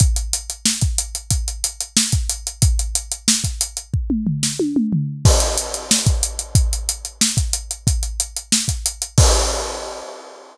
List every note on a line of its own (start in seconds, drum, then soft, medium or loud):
0.00 kick medium
0.00 closed hi-hat medium
0.16 closed hi-hat medium
0.33 closed hi-hat medium
0.50 closed hi-hat medium
0.65 snare medium
0.81 kick medium
0.81 closed hi-hat medium
0.98 closed hi-hat medium
1.15 closed hi-hat medium
1.30 kick medium
1.30 closed hi-hat medium
1.48 closed hi-hat medium
1.64 closed hi-hat medium
1.80 closed hi-hat medium
1.97 snare loud
2.12 kick medium
2.12 closed hi-hat medium
2.29 closed hi-hat medium
2.47 closed hi-hat medium
2.62 kick loud
2.62 closed hi-hat medium
2.79 closed hi-hat medium
2.95 closed hi-hat medium
3.12 closed hi-hat medium
3.28 snare loud
3.44 kick medium
3.44 closed hi-hat medium
3.61 closed hi-hat medium
3.77 closed hi-hat medium
3.94 kick medium
4.10 mid tom medium
4.27 floor tom medium
4.43 snare medium
4.59 high tom medium
4.76 mid tom medium
4.93 floor tom medium
5.25 kick medium
5.25 crash medium
5.40 closed hi-hat medium
5.58 closed hi-hat loud
5.74 closed hi-hat medium
5.91 snare loud
6.06 kick medium
6.06 closed hi-hat medium
6.23 closed hi-hat medium
6.39 closed hi-hat medium
6.55 kick medium
6.55 closed hi-hat medium
6.73 closed hi-hat medium
6.89 closed hi-hat medium
7.05 closed hi-hat medium
7.21 snare loud
7.37 kick medium
7.37 closed hi-hat medium
7.53 closed hi-hat medium
7.71 closed hi-hat medium
7.87 kick medium
7.87 closed hi-hat medium
8.03 closed hi-hat medium
8.20 closed hi-hat medium
8.36 closed hi-hat medium
8.52 snare medium
8.68 kick medium
8.68 closed hi-hat medium
8.86 closed hi-hat medium
9.02 closed hi-hat medium
9.18 kick loud
9.18 crash loud